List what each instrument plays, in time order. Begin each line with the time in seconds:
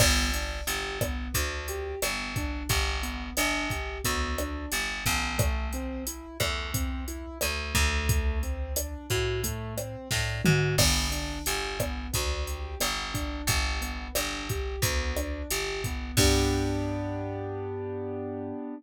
0.00 electric bass (finger) G1, acoustic grand piano B3, kick, cross-stick, crash
0.34 acoustic grand piano D4, closed hi-hat
0.67 electric bass (finger) G1, acoustic grand piano G4, closed hi-hat
1.01 acoustic grand piano B3, kick, cross-stick, closed hi-hat
1.34 electric bass (finger) D2, acoustic grand piano D4, kick, closed hi-hat
1.68 acoustic grand piano G4, closed hi-hat
2.02 electric bass (finger) G1, acoustic grand piano B3, cross-stick, closed hi-hat
2.36 acoustic grand piano D4, kick, closed hi-hat
2.69 electric bass (finger) G1, acoustic grand piano G4, kick, closed hi-hat
3.03 acoustic grand piano B3, closed hi-hat
3.37 electric bass (finger) G1, acoustic grand piano D4, cross-stick, closed hi-hat
3.70 acoustic grand piano G4, kick, closed hi-hat
4.04 electric bass (finger) D2, acoustic grand piano B3, kick, closed hi-hat
4.38 acoustic grand piano D4, cross-stick, closed hi-hat
4.72 electric bass (finger) G1, acoustic grand piano G4, closed hi-hat
5.06 electric bass (finger) A1, acoustic grand piano B3, kick, closed hi-hat
5.38 acoustic grand piano A3, kick, cross-stick, closed hi-hat
5.73 acoustic grand piano C4, closed hi-hat
6.07 acoustic grand piano E4, closed hi-hat
6.40 electric bass (finger) E2, acoustic grand piano A3, kick, cross-stick, closed hi-hat
6.74 acoustic grand piano C4, kick, closed hi-hat
7.08 acoustic grand piano E4, closed hi-hat
7.41 electric bass (finger) D2, acoustic grand piano A3, cross-stick, closed hi-hat
7.75 electric bass (finger) D2, acoustic grand piano A3, kick, closed hi-hat
8.09 kick, closed hi-hat
8.43 acoustic grand piano C4, closed hi-hat
8.76 acoustic grand piano D4, cross-stick, closed hi-hat
9.10 electric bass (finger) A2, acoustic grand piano F#4, kick, closed hi-hat
9.44 acoustic grand piano A3, kick, closed hi-hat
9.78 acoustic grand piano C4, cross-stick, closed hi-hat
10.11 electric bass (finger) A2, acoustic grand piano D4, kick, snare
10.45 electric bass (finger) G#2, acoustic grand piano F#4, mid tom
10.78 electric bass (finger) G1, acoustic grand piano B3, kick, cross-stick, crash
11.11 acoustic grand piano D4, closed hi-hat
11.46 electric bass (finger) G1, acoustic grand piano G4, closed hi-hat
11.80 acoustic grand piano B3, kick, cross-stick, closed hi-hat
12.13 electric bass (finger) D2, acoustic grand piano D4, kick, closed hi-hat
12.47 acoustic grand piano G4, closed hi-hat
12.80 electric bass (finger) G1, acoustic grand piano B3, cross-stick, closed hi-hat
13.14 acoustic grand piano D4, kick, closed hi-hat
13.47 electric bass (finger) G1, acoustic grand piano G4, kick, closed hi-hat
13.81 acoustic grand piano B3, closed hi-hat
14.15 electric bass (finger) G1, acoustic grand piano D4, cross-stick, closed hi-hat
14.49 acoustic grand piano G4, kick, closed hi-hat
14.82 electric bass (finger) D2, acoustic grand piano B3, kick, closed hi-hat
15.17 acoustic grand piano D4, cross-stick, closed hi-hat
15.51 electric bass (finger) G1, acoustic grand piano G4, closed hi-hat
15.84 acoustic grand piano B3, kick, closed hi-hat
16.17 electric bass (finger) G2, acoustic grand piano B3 D4 G4, kick, crash